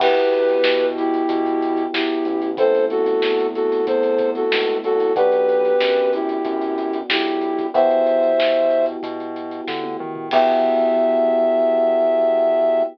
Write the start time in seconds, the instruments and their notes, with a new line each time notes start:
0.00 synth bass 1 E2, electric piano 1 B3 E4 F#4 G4, flute G4 B4, kick, crash
0.16 closed hi-hat
0.33 closed hi-hat
0.49 closed hi-hat
0.64 synth bass 1 B2, snare
0.80 closed hi-hat
0.97 flute E4 G4, closed hi-hat
1.14 closed hi-hat
1.29 synth bass 1 B2, kick, closed hi-hat
1.46 closed hi-hat
1.62 closed hi-hat
1.77 closed hi-hat
1.94 synth bass 1 E2, flute E4 G4, snare
2.10 closed hi-hat
2.25 synth bass 1 A1, closed hi-hat
2.42 closed hi-hat
2.57 electric piano 1 A3 B3 C4 E4, flute A4 C5, kick, closed hi-hat
2.75 closed hi-hat
2.90 flute F#4 A4, closed hi-hat
3.06 closed hi-hat
3.22 synth bass 1 E2, snare
3.40 closed hi-hat
3.55 flute F#4 A4, closed hi-hat
3.72 closed hi-hat
3.87 synth bass 1 E2, flute A4 C5, kick, closed hi-hat
4.03 closed hi-hat
4.18 kick, closed hi-hat
4.35 flute F#4 A4, closed hi-hat
4.52 synth bass 1 C#2, snare
4.68 closed hi-hat
4.84 synth bass 1 C2, flute F#4 A4, closed hi-hat
5.00 closed hi-hat
5.16 synth bass 1 B1, electric piano 1 B3 D4 F#4, flute G4 B4, kick, closed hi-hat
5.32 closed hi-hat
5.49 closed hi-hat
5.65 closed hi-hat
5.81 synth bass 1 F#2, snare
5.96 closed hi-hat
6.13 flute E4 G4, closed hi-hat
6.29 closed hi-hat
6.45 synth bass 1 F#2, kick, closed hi-hat
6.61 closed hi-hat
6.78 closed hi-hat
6.93 closed hi-hat
7.10 synth bass 1 B1, flute E4 G4, snare
7.26 closed hi-hat
7.41 closed hi-hat
7.58 kick, closed hi-hat
7.74 synth bass 1 E2, electric piano 1 B3 E4 F#4 G4, flute C5 E5, kick, closed hi-hat
7.91 closed hi-hat
8.06 closed hi-hat
8.23 closed hi-hat
8.39 synth bass 1 B2, snare
8.55 closed hi-hat
8.70 closed hi-hat
8.86 closed hi-hat
9.03 synth bass 1 B2, kick, closed hi-hat
9.20 closed hi-hat
9.36 closed hi-hat
9.51 closed hi-hat
9.68 synth bass 1 D3, kick, snare
9.84 high tom
10.00 synth bass 1 D#3, mid tom
10.15 floor tom
10.31 synth bass 1 E2, electric piano 1 B3 E4 F#4 G4, flute E5, kick, crash